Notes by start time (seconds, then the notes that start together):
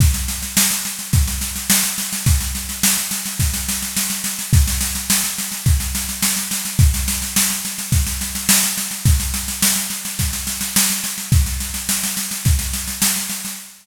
0.00 kick, snare
0.14 snare
0.28 snare
0.42 snare
0.57 snare
0.71 snare
0.85 snare
0.99 snare
1.13 kick, snare
1.27 snare
1.41 snare
1.56 snare
1.70 snare
1.83 snare
1.98 snare
2.13 snare
2.26 kick, snare
2.40 snare
2.55 snare
2.69 snare
2.83 snare
2.98 snare
3.11 snare
3.26 snare
3.40 kick, snare
3.54 snare
3.69 snare
3.82 snare
3.97 snare
4.10 snare
4.24 snare
4.39 snare
4.53 kick, snare
4.68 snare
4.81 snare
4.95 snare
5.10 snare
5.24 snare
5.38 snare
5.52 snare
5.66 kick, snare
5.80 snare
5.95 snare
6.09 snare
6.23 snare
6.36 snare
6.51 snare
6.65 snare
6.79 kick, snare
6.94 snare
7.08 snare
7.22 snare
7.36 snare
7.50 snare
7.65 snare
7.78 snare
7.92 kick, snare
8.07 snare
8.21 snare
8.35 snare
8.49 snare
8.63 snare
8.77 snare
8.91 snare
9.05 kick, snare
9.20 snare
9.34 snare
9.48 snare
9.62 snare
9.76 snare
9.90 snare
10.05 snare
10.19 kick, snare
10.33 snare
10.47 snare
10.61 snare
10.76 snare
10.90 snare
11.04 snare
11.18 snare
11.32 kick, snare
11.46 snare
11.60 snare
11.74 snare
11.89 snare
12.03 snare
12.17 snare
12.31 snare
12.45 kick, snare
12.59 snare
12.73 snare
12.88 snare
13.02 snare
13.16 snare
13.29 snare
13.45 snare